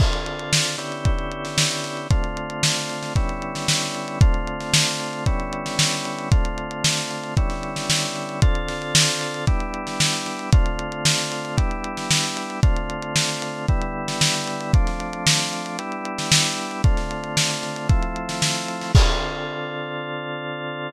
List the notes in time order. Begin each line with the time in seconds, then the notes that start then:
0.00 D3 C4 F4 A4, kick, crash
0.13 closed hi-hat
0.26 closed hi-hat
0.39 closed hi-hat
0.53 snare
0.66 closed hi-hat
0.78 D3 B3 C#4 E4 G4, closed hi-hat
0.92 closed hi-hat
1.05 kick, closed hi-hat
1.19 closed hi-hat
1.31 closed hi-hat
1.45 snare, closed hi-hat
1.58 snare
1.71 closed hi-hat
1.84 snare, closed hi-hat
1.97 closed hi-hat
2.10 D3 A3 C4 F4, kick, closed hi-hat
2.24 closed hi-hat
2.37 closed hi-hat
2.50 closed hi-hat
2.63 snare
2.76 closed hi-hat
2.89 snare, closed hi-hat
3.03 snare, closed hi-hat
3.16 D3 G3 B3 C#4 E4, kick, closed hi-hat
3.29 closed hi-hat
3.42 closed hi-hat
3.55 snare, closed hi-hat
3.68 snare
3.82 snare, closed hi-hat
3.95 closed hi-hat
4.08 closed hi-hat
4.21 D3 A3 C4 F4, kick, closed hi-hat
4.34 closed hi-hat
4.47 closed hi-hat
4.60 snare, closed hi-hat
4.74 snare
4.87 closed hi-hat
5.00 closed hi-hat
5.13 closed hi-hat
5.26 D3 G3 B3 C#4 E4, kick, closed hi-hat
5.40 closed hi-hat
5.53 closed hi-hat
5.66 snare, closed hi-hat
5.79 snare
5.92 closed hi-hat
6.05 closed hi-hat
6.19 closed hi-hat
6.31 D3 A3 C4 F4, kick, closed hi-hat
6.45 closed hi-hat
6.58 closed hi-hat
6.71 closed hi-hat
6.84 snare
6.97 closed hi-hat
7.11 closed hi-hat
7.23 closed hi-hat
7.37 D3 G3 B3 C#4 E4, kick, closed hi-hat
7.50 snare, closed hi-hat
7.63 closed hi-hat
7.76 snare, closed hi-hat
7.90 snare
8.03 closed hi-hat
8.16 closed hi-hat
8.29 closed hi-hat
8.42 D3 C4 F4 A4, kick, closed hi-hat
8.55 closed hi-hat
8.68 snare, closed hi-hat
8.82 closed hi-hat
8.95 snare
9.08 closed hi-hat
9.21 closed hi-hat
9.34 closed hi-hat
9.47 G3 B3 D4 E4, kick, closed hi-hat
9.60 closed hi-hat
9.74 closed hi-hat
9.87 snare, closed hi-hat
10.00 snare
10.13 closed hi-hat
10.26 snare, closed hi-hat
10.39 closed hi-hat
10.53 D3 A3 C4 F4, kick, closed hi-hat
10.66 closed hi-hat
10.79 closed hi-hat
10.92 closed hi-hat
11.05 snare
11.18 closed hi-hat
11.32 closed hi-hat
11.45 closed hi-hat
11.57 G3 B3 D4 E4, kick, closed hi-hat
11.71 closed hi-hat
11.84 closed hi-hat
11.97 snare, closed hi-hat
12.11 snare
12.24 closed hi-hat
12.37 closed hi-hat
12.50 closed hi-hat
12.63 D3 A3 C4 F4, kick, closed hi-hat
12.76 closed hi-hat
12.90 closed hi-hat
13.02 closed hi-hat
13.16 snare
13.29 closed hi-hat
13.42 closed hi-hat
13.68 D3 G3 B3 E4, kick, closed hi-hat
13.81 closed hi-hat
14.08 snare, closed hi-hat
14.21 snare
14.34 closed hi-hat
14.47 closed hi-hat
14.61 closed hi-hat
14.73 F3 A3 C4 D4, kick, closed hi-hat
14.87 snare, closed hi-hat
15.00 closed hi-hat
15.13 closed hi-hat
15.27 snare
15.39 closed hi-hat
15.53 closed hi-hat
15.66 closed hi-hat
15.79 G3 B3 D4 E4, closed hi-hat
15.92 closed hi-hat
16.05 closed hi-hat
16.18 snare, closed hi-hat
16.32 snare
16.45 closed hi-hat
16.58 closed hi-hat
16.71 closed hi-hat
16.84 D3 A3 C4 F4, kick, closed hi-hat
16.97 snare, closed hi-hat
17.11 closed hi-hat
17.24 closed hi-hat
17.37 snare
17.50 closed hi-hat
17.63 snare, closed hi-hat
17.76 closed hi-hat
17.89 F3 A3 C4 E4, kick, closed hi-hat
18.03 closed hi-hat
18.16 closed hi-hat
18.29 snare, closed hi-hat
18.42 snare
18.55 closed hi-hat
18.68 closed hi-hat
18.81 snare, open hi-hat
18.95 D3 C4 F4 A4, kick, crash